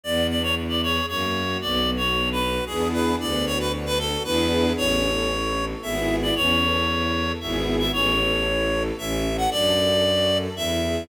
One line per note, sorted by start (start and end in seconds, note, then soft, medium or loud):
0.04 1.00 E2 medium
0.04 0.27 B3 loud
0.04 0.27 D5 medium
0.30 0.54 D4 medium
0.30 0.42 D5 medium
0.42 0.55 C#5 medium
0.56 0.80 E4 medium
0.69 0.81 D5 medium
0.83 1.06 G#4 medium
0.83 1.06 C#5 medium
1.08 1.57 F#2 medium
1.08 1.32 A#3 loud
1.08 1.58 C#5 medium
1.35 1.59 F#4 medium
1.61 2.60 B1 medium
1.61 1.85 B3 loud
1.61 1.91 D5 medium
1.88 2.12 F#4 medium
1.97 2.29 C#5 medium
2.14 2.38 D4 medium
2.32 2.64 B4 medium
2.40 2.64 F#4 medium
2.66 3.16 E2 medium
2.66 3.14 B3 loud
2.66 3.14 D4 loud
2.66 3.14 E4 loud
2.66 2.88 G#4 medium
2.66 3.14 G#4 loud
2.93 3.16 B4 medium
3.19 4.16 D2 medium
3.19 3.43 B3 loud
3.19 3.45 D5 medium
3.46 3.69 F#4 loud
3.46 3.58 C#5 medium
3.60 3.72 B4 medium
3.72 3.96 D4 medium
3.86 3.98 B4 medium
3.99 4.22 F#4 medium
3.99 4.23 A4 medium
4.24 4.73 E2 medium
4.24 4.72 B3 loud
4.24 4.72 D4 loud
4.24 4.72 E4 loud
4.24 4.72 G#4 loud
4.24 4.73 B4 medium
4.77 5.74 A1 medium
4.77 5.01 C#4 loud
4.77 5.65 C#5 medium
5.04 5.28 A4 medium
5.30 5.54 E4 medium
5.56 5.80 A4 medium
5.82 6.32 G#1 medium
5.82 6.30 B3 loud
5.82 6.30 E4 loud
5.82 6.30 G#4 loud
5.82 6.16 E5 medium
6.22 6.35 D5 medium
6.35 7.32 E2 medium
6.35 6.59 C#4 loud
6.35 7.32 C#5 medium
6.61 6.85 A4 medium
6.88 7.12 E4 medium
7.14 7.38 A4 medium
7.40 7.90 G#1 medium
7.40 7.88 B3 loud
7.40 7.88 E4 loud
7.40 7.88 G#4 loud
7.40 7.76 E5 medium
7.79 7.92 E5 medium
7.93 8.91 A1 loud
7.93 8.17 C#4 loud
7.93 8.83 C#5 medium
8.19 8.43 A4 medium
8.46 8.69 E4 medium
8.72 8.96 A4 loud
8.98 9.47 A1 loud
8.98 9.22 C#4 loud
8.98 9.37 E5 medium
9.24 9.48 A4 medium
9.37 9.50 F#5 medium
9.51 10.48 F#2 medium
9.51 9.75 D4 loud
9.51 10.38 D5 medium
9.77 10.01 A4 medium
10.04 10.28 F#4 medium
10.30 10.54 A4 medium
10.56 11.04 E2 medium
10.56 10.80 E4 loud
10.56 11.04 E5 medium
10.82 11.06 G#4 medium